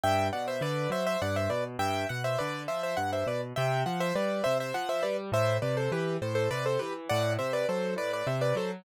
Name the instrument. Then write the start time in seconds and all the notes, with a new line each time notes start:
acoustic grand piano
0.04 G2 E5 G5
0.33 B2 D5 F#5
0.48 C5 E5
0.61 D3 B4 D5
0.90 F#3 C5 E5
1.07 C5 E5
1.22 G2 D5 F#5
1.36 C5 E5
1.50 B2 B4 D5
1.79 G2 E5 G5
2.09 B2 F#5
2.24 C5 E5
2.38 D3 B4 D5
2.68 F3 C5 E5
2.83 C5 E5
2.97 G2 F#5
3.13 C5 E5
3.27 B2 B4 D5
3.56 C3 E5 G5
3.86 F3 F#5
4.00 C5 E5
4.15 G3 B4 D5
4.44 C3 C5 E5
4.60 C5 E5
4.74 F3 F#5
4.89 C5 E5
5.03 G3 B4 D5
5.32 A2 C5 E5
5.62 C3 B4 D5
5.77 A4 C5
5.92 E3 G4 B4
6.22 A2 A4 C5
6.35 A4 C5
6.51 C3 B4 D5
6.66 A4 C5
6.79 E3 G4 B4
7.09 A2 D5 F#5
7.39 C3 C5 E5
7.53 B4 D5
7.69 F#3 A4 C5
7.96 A2 B4 D5
8.13 B4 D5
8.27 C3 C5 E5
8.41 B4 D5
8.55 F#3 A4 C5